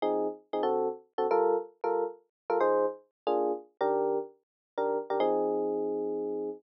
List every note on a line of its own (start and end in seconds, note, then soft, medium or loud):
0.02 0.27 F3 medium
0.02 0.27 C4 medium
0.02 0.27 D#4 loud
0.02 0.27 G#4 medium
0.53 0.62 F3 medium
0.53 0.62 C4 medium
0.53 0.62 D#4 medium
0.53 0.62 G#4 medium
0.63 0.88 D3 medium
0.63 0.88 C4 loud
0.63 0.88 F#4 medium
0.63 0.88 A4 medium
1.18 1.27 D3 medium
1.18 1.27 C4 medium
1.18 1.27 F#4 medium
1.18 1.27 A4 medium
1.31 1.56 G3 medium
1.31 1.56 F4 medium
1.31 1.56 A4 loud
1.31 1.56 A#4 medium
1.84 2.04 G3 medium
1.84 2.04 F4 medium
1.84 2.04 A4 medium
1.84 2.04 A#4 medium
2.50 2.58 G3 medium
2.50 2.58 F4 medium
2.50 2.58 A4 medium
2.50 2.58 A#4 medium
2.60 2.86 F3 medium
2.60 2.86 D#4 medium
2.60 2.86 G#4 medium
2.60 2.86 C5 loud
3.27 3.52 A#3 medium
3.27 3.52 D4 medium
3.27 3.52 F4 medium
3.27 3.52 G#4 medium
3.81 4.18 D#3 medium
3.81 4.18 D4 medium
3.81 4.18 G4 loud
3.81 4.18 A#4 medium
4.78 4.98 D#3 medium
4.78 4.98 D4 medium
4.78 4.98 G4 medium
4.78 4.98 A#4 medium
5.10 5.19 D#3 medium
5.10 5.19 D4 medium
5.10 5.19 G4 medium
5.10 5.19 A#4 medium
5.20 6.50 F3 loud
5.20 6.50 C4 loud
5.20 6.50 D#4 medium
5.20 6.50 G#4 loud